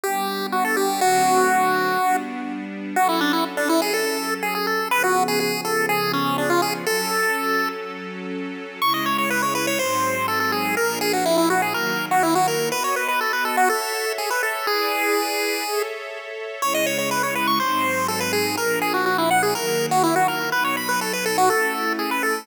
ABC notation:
X:1
M:4/4
L:1/16
Q:1/4=123
K:Bm
V:1 name="Lead 1 (square)"
G4 F A G2 | F10 z6 | [K:F#m] F E D E z D E G A4 G G A2 | B F2 G G2 A2 G2 C2 D ^E G z |
A8 z8 | [K:C#m] c' d c c B c B c ^B4 A A G2 | ^A2 G F E E F G A3 F E F A2 | B c B B A B A F A4 G B A2 |
G10 z6 | c d c c B c B c' ^B4 A =B G2 | ^A2 G F F E f G A3 F E F A2 | B c b B A B A F A4 G B A2 |]
V:2 name="String Ensemble 1"
[G,B,D]8 | [D,F,A,=C]8 [G,B,D]8 | [K:F#m] [F,CA]16 | [C,^E,B,G]16 |
[F,CA]16 | [K:C#m] [C,G,E]8 [G,,F,^B,D]8 | [^A,,^E,=D]8 [^D,F,^A,]8 | [B,Fd]8 [Ace]8 |
[EGB=d]8 [Ace]8 | [C,G,E]8 [G,,F,^B,D]8 | [^A,,^E,=D]8 [^D,F,^A,]8 | [B,,F,D]8 [A,CE]8 |]